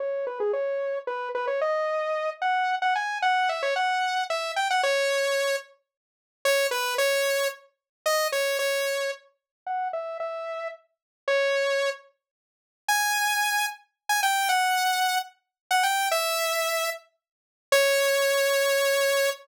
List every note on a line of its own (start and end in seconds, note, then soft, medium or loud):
0.00 0.26 C#5 medium
0.27 0.39 B4 medium
0.40 0.52 G#4 medium
0.53 0.99 C#5 medium
1.07 1.29 B4 medium
1.35 1.46 B4 medium
1.47 1.60 C#5 medium
1.61 2.30 D#5 medium
2.42 2.75 F#5 medium
2.82 2.94 F#5 medium
2.96 3.18 G#5 medium
3.22 3.49 F#5 medium
3.49 3.62 E5 medium
3.63 3.74 C#5 medium
3.76 4.24 F#5 medium
4.30 4.52 E5 medium
4.56 4.68 G5 medium
4.71 4.81 F#5 medium
4.83 5.56 C#5 medium
6.45 6.67 C#5 medium
6.71 6.94 B4 medium
6.98 7.48 C#5 medium
8.06 8.28 D#5 medium
8.32 8.58 C#5 medium
8.59 9.11 C#5 medium
9.66 9.88 F#5 medium
9.93 10.18 E5 medium
10.20 10.68 E5 medium
11.28 11.90 C#5 medium
12.88 13.66 G#5 medium
14.09 14.21 G#5 medium
14.23 14.48 G5 medium
14.49 15.18 F#5 medium
15.71 15.83 F#5 medium
15.83 16.09 G5 medium
16.11 16.90 E5 medium
17.72 19.30 C#5 loud